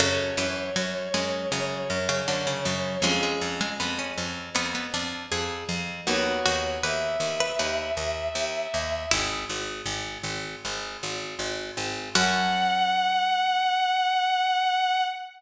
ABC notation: X:1
M:4/4
L:1/16
Q:1/4=79
K:F#m
V:1 name="Violin"
c16 | z16 | c4 e12 | z16 |
f16 |]
V:2 name="Harpsichord"
C,2 E,2 F, z G,2 C,2 z C, D, C, C,2 | G, G, z G, B, C3 B, B, D2 G4 | z2 F2 B3 B B8 | E4 z12 |
F16 |]
V:3 name="Acoustic Guitar (steel)"
[CFA]16 | [C^EG]16 | [B,^DF]16 | z16 |
[CFA]16 |]
V:4 name="Harpsichord" clef=bass
F,,2 F,,2 F,,2 F,,2 F,,2 F,,2 F,,2 F,,2 | ^E,,2 E,,2 E,,2 E,,2 E,,2 E,,2 E,,2 E,,2 | ^D,,2 D,,2 D,,2 D,,2 D,,2 D,,2 D,,2 D,,2 | G,,,2 G,,,2 G,,,2 G,,,2 G,,,2 G,,,2 G,,,2 G,,,2 |
F,,16 |]